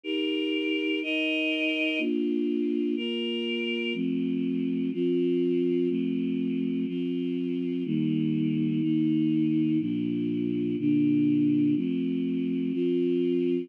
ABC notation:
X:1
M:4/4
L:1/8
Q:1/4=123
K:F
V:1 name="Choir Aahs"
[_EGB]4 [EB_e]4 | [B,DF]4 [B,FB]4 | [F,A,C]4 [F,CF]4 | [F,A,C]4 [F,CF]4 |
[_E,G,B,]4 [E,B,_E]4 | [B,,F,D]4 [B,,D,D]4 | [F,A,C]4 [F,CF]4 |]